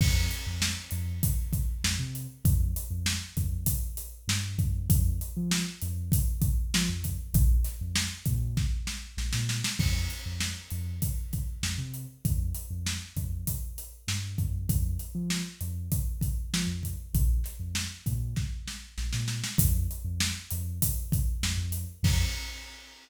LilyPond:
<<
  \new Staff \with { instrumentName = "Synth Bass 2" } { \clef bass \time 4/4 \key f \minor \tempo 4 = 98 f,8. f,8. f,4. f,16 c8. | f,8. f,8. f,4. g,8 ges,8 | f,8. f8. f,4. f16 f,8. | bes,,8. f,8. bes,4. bes,,16 bes,8. |
f,8. f,8. f,4. f,16 c8. | f,8. f,8. f,4. g,8 ges,8 | f,8. f8. f,4. f16 f,8. | bes,,8. f,8. bes,4. bes,,16 bes,8. |
f,8. f,8. f,4. f,16 f,8. | f,4 r2. | }
  \new DrumStaff \with { instrumentName = "Drums" } \drummode { \time 4/4 <cymc bd>8 hh8 sn8 hh8 <hh bd>8 <hh bd>8 sn8 hh8 | <hh bd>8 hh8 sn8 <hh bd>8 <hh bd>8 hh8 sn8 <hh bd>8 | <hh bd>8 hh8 sn8 hh8 <hh bd>8 <hh bd>8 sn8 <hh bd>8 | <hh bd>8 <hh sn>8 sn8 <hh bd>8 <bd sn>8 sn8 sn16 sn16 sn16 sn16 |
<cymc bd>8 hh8 sn8 hh8 <hh bd>8 <hh bd>8 sn8 hh8 | <hh bd>8 hh8 sn8 <hh bd>8 <hh bd>8 hh8 sn8 <hh bd>8 | <hh bd>8 hh8 sn8 hh8 <hh bd>8 <hh bd>8 sn8 <hh bd>8 | <hh bd>8 <hh sn>8 sn8 <hh bd>8 <bd sn>8 sn8 sn16 sn16 sn16 sn16 |
<hh bd>8 hh8 sn8 hh8 <hh bd>8 <hh bd>8 sn8 hh8 | <cymc bd>4 r4 r4 r4 | }
>>